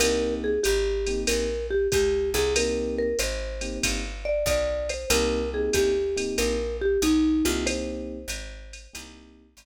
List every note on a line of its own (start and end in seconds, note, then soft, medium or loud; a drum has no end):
0.00 0.59 C2 medium
0.00 0.51 A#3 medium
0.00 0.51 C4 medium
0.00 0.51 D#4 loud
0.00 0.51 G4 medium
0.00 0.34 A#4 loud
0.00 ride loud
0.44 0.61 G#4 medium
0.63 1.25 G#1 medium
0.63 1.20 G4 medium
0.63 hi-hat pedal medium
0.63 ride medium
1.07 1.45 A#3 medium
1.07 1.45 C4 medium
1.07 1.45 D#4 medium
1.07 1.45 G4 medium
1.07 ride medium
1.27 1.88 A#1 medium
1.27 1.67 A#4 medium
1.27 ride loud
1.70 1.88 G4 medium
1.92 2.34 C#2 medium
1.92 2.30 G4 loud
1.92 kick medium
1.92 hi-hat pedal medium
1.92 ride medium
2.34 3.14 C2 medium
2.34 2.54 G#4 medium
2.34 ride medium
2.56 3.07 A#3 medium
2.56 3.07 C4 medium
2.56 3.07 D#4 medium
2.56 3.07 G4 medium
2.56 2.96 A#4 medium
2.56 ride loud
2.98 3.18 A#4 medium
3.19 3.79 G#1 medium
3.19 3.76 C5 loud
3.19 hi-hat pedal medium
3.19 ride medium
3.61 3.99 A#3 medium
3.61 3.99 C4 medium
3.61 3.99 D#4 medium
3.61 3.99 G4 medium
3.61 ride medium
3.83 4.44 G1 medium
3.83 kick medium
3.83 ride loud
4.25 4.45 D5 medium
4.46 5.05 B1 medium
4.46 4.89 D5 loud
4.46 kick medium
4.46 hi-hat pedal medium
4.46 ride medium
4.89 5.08 C5 medium
4.89 ride medium
5.10 5.70 C2 loud
5.10 5.40 A#3 medium
5.10 5.40 C4 medium
5.10 5.40 D#4 medium
5.10 5.40 G4 medium
5.10 5.50 A#4 medium
5.10 ride loud
5.53 5.91 A#3 medium
5.53 5.91 C4 medium
5.53 5.91 D#4 medium
5.53 5.91 G4 medium
5.53 5.72 G#4 medium
5.73 6.34 D2 medium
5.73 6.36 G4 medium
5.73 kick medium
5.73 hi-hat pedal medium
5.73 ride medium
6.16 6.55 A#3 medium
6.16 6.55 C4 medium
6.16 6.55 D#4 medium
6.16 6.55 G4 medium
6.16 ride medium
6.38 6.98 A#1 medium
6.38 6.77 A#4 medium
6.38 ride medium
6.81 7.00 G4 medium
7.02 7.43 B1 medium
7.02 7.44 D#4 medium
7.02 hi-hat pedal medium
7.02 ride medium
7.45 8.26 C2 medium
7.45 8.17 A#3 medium
7.45 8.17 C4 medium
7.45 8.17 D#4 medium
7.45 7.65 F4 medium
7.45 8.17 G4 loud
7.45 ride medium
7.66 9.02 C5 loud
7.66 ride medium
8.28 8.88 G#1 medium
8.28 hi-hat pedal medium
8.28 ride medium
8.73 ride medium
8.93 9.55 C2 medium
8.93 9.45 A#3 medium
8.93 9.45 C4 medium
8.93 9.45 D#4 medium
8.93 9.45 G4 medium
8.93 ride loud
9.57 9.65 G#1 medium
9.57 hi-hat pedal medium
9.57 ride medium